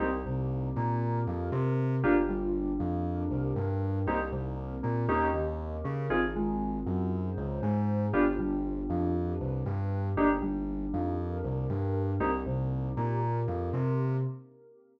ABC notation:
X:1
M:4/4
L:1/16
Q:1/4=118
K:Cm
V:1 name="Electric Piano 2"
[B,CEG] z C,4 B,4 F,2 C4 | [B,DFG] z G,4 F,4 C,2 G,4 | [B,CEG] z C,4 B,2 [B,_DEG]2 E,4 D2 | [CEFA] z A,4 _G,4 _D,2 A,4 |
[=B,DFG] z G,4 F,4 C,2 G,4 | [B,DEG] z G,4 F,4 C,2 G,4 | [B,CEG] z C,4 B,4 F,2 C4 |]
V:2 name="Synth Bass 2" clef=bass
C,,2 C,,4 B,,4 F,,2 C,4 | G,,,2 G,,,4 F,,4 C,,2 G,,4 | C,,2 C,,4 B,,2 E,,2 E,,4 _D,2 | A,,,2 A,,,4 _G,,4 _D,,2 A,,4 |
G,,,2 G,,,4 F,,4 C,,2 G,,4 | G,,,2 G,,,4 F,,4 C,,2 G,,4 | C,,2 C,,4 B,,4 F,,2 C,4 |]
V:3 name="Pad 5 (bowed)"
[B,CEG]8 [B,CGB]8 | [B,DFG]8 [B,DGB]8 | [B,CEG]4 [B,CGB]4 [B,_DEG]4 [B,DGB]4 | [CEFA]8 [CEAc]8 |
[=B,DFG]8 [B,DG=B]8 | [B,DEG]8 [B,DGB]8 | [B,CEG]8 [B,CGB]8 |]